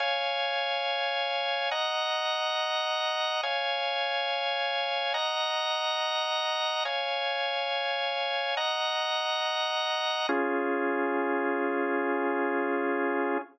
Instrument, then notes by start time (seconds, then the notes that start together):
drawbar organ
0.00 C#5 F5 G#5
1.71 D#5 F#5 A#5
3.43 C#5 F5 G#5
5.14 D#5 F#5 A#5
6.85 C#5 F5 G#5
8.57 D#5 F#5 A#5
10.29 C#4 F4 G#4